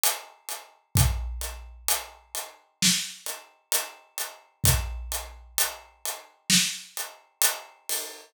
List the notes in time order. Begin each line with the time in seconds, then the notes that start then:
0.04 closed hi-hat
0.49 closed hi-hat
0.95 kick, closed hi-hat
1.41 closed hi-hat
1.88 closed hi-hat
2.35 closed hi-hat
2.83 snare
3.26 closed hi-hat
3.72 closed hi-hat
4.18 closed hi-hat
4.64 kick, closed hi-hat
5.12 closed hi-hat
5.58 closed hi-hat
6.06 closed hi-hat
6.50 snare
6.97 closed hi-hat
7.42 closed hi-hat
7.89 open hi-hat